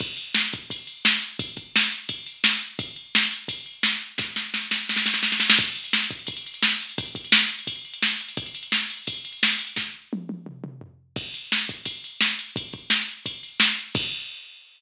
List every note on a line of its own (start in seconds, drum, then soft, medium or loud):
0.00 kick medium
0.00 crash medium
0.17 ride medium
0.35 snare medium
0.53 kick medium
0.53 ride medium
0.70 kick medium
0.70 ride medium
0.87 ride medium
1.05 snare medium
1.21 ride medium
1.39 kick medium
1.39 ride medium
1.57 kick medium
1.57 ride medium
1.76 snare medium
1.92 ride medium
2.09 kick medium
2.09 ride medium
2.26 ride medium
2.44 snare medium
2.61 ride medium
2.79 kick medium
2.79 ride medium
2.96 ride soft
3.15 snare medium
3.31 ride medium
3.48 kick medium
3.48 ride medium
3.66 ride medium
3.83 snare medium
4.01 ride medium
4.18 kick medium
4.18 snare medium
4.36 snare medium
4.54 snare medium
4.71 snare medium
4.89 snare medium
4.96 snare medium
5.06 snare medium
5.14 snare medium
5.23 snare medium
5.32 snare medium
5.40 snare medium
5.50 snare medium
5.58 kick medium
5.58 crash medium
5.68 ride medium
5.75 ride medium
5.84 ride medium
5.93 snare medium
6.02 ride medium
6.10 kick medium
6.10 ride medium
6.19 ride soft
6.27 kick medium
6.27 ride medium
6.37 ride medium
6.46 ride medium
6.54 ride medium
6.62 snare medium
6.71 ride medium
6.80 ride medium
6.90 ride medium
6.98 kick medium
6.98 ride medium
7.06 ride medium
7.15 kick medium
7.15 ride medium
7.24 ride medium
7.32 snare loud
7.40 ride medium
7.49 ride medium
7.59 ride medium
7.67 kick medium
7.67 ride medium
7.76 ride soft
7.85 ride medium
7.94 ride medium
8.02 snare medium
8.11 ride medium
8.20 ride medium
8.28 ride medium
8.37 kick medium
8.37 ride medium
8.46 ride medium
8.55 ride medium
8.63 ride medium
8.72 snare medium
8.81 ride medium
8.90 ride medium
8.97 ride medium
9.07 kick medium
9.07 ride medium
9.14 ride medium
9.25 ride medium
9.32 ride soft
9.43 snare medium
9.50 ride medium
9.59 ride medium
9.67 ride medium
9.76 kick medium
9.76 snare medium
10.13 high tom medium
10.29 high tom medium
10.46 mid tom medium
10.64 mid tom medium
10.81 floor tom medium
11.16 kick medium
11.16 crash medium
11.34 ride medium
11.52 snare medium
11.69 kick medium
11.69 ride medium
11.85 kick medium
11.85 ride medium
12.04 ride medium
12.21 snare medium
12.39 ride medium
12.56 kick medium
12.56 ride medium
12.73 kick medium
12.73 ride soft
12.90 snare medium
13.08 ride medium
13.26 kick medium
13.26 ride medium
13.43 ride medium
13.60 snare medium
13.78 ride medium
13.95 kick loud
13.95 crash loud